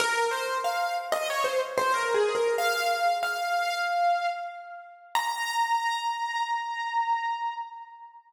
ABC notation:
X:1
M:4/4
L:1/16
Q:1/4=93
K:Bbm
V:1 name="Acoustic Grand Piano"
B2 c2 f2 z e d c z c (3B2 A2 B2 | f4 f8 z4 | b16 |]